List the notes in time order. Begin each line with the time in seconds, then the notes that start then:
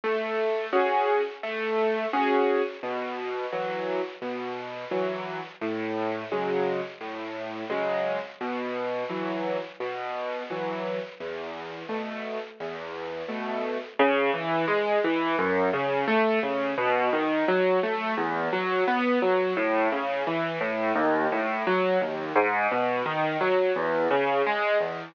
0.04 A3
0.73 C#4 F#4 G#4
1.43 A3
2.13 C#4 F#4 G#4
2.83 B2
3.52 E3 F#3
4.22 B2
4.91 E3 F#3
5.61 A2
6.32 C#3 F#3 G#3
7.01 A2
7.70 C#3 F#3 G#3
8.41 B2
9.09 E3 F#3
9.80 B2
10.50 E3 F#3
11.20 E2
11.89 B2 A3
12.60 E2
13.28 B2 A3
13.99 C#3
14.34 E3
14.68 G#3
15.04 E3
15.39 F#2
15.73 C#3
16.08 A3
16.43 C#3
16.78 B2
17.13 D#3
17.48 F#3
17.83 A3
18.17 E2
18.53 F#3
18.88 B3
19.22 F#3
19.57 A2
19.92 C#3
20.27 E3
20.61 A2
20.95 D#2
21.32 A2
21.67 F#3
22.01 D#2
22.35 G#2
22.71 B2
23.06 D#3
23.41 F#3
23.76 E2
24.11 C#3
24.47 G#3
24.80 E2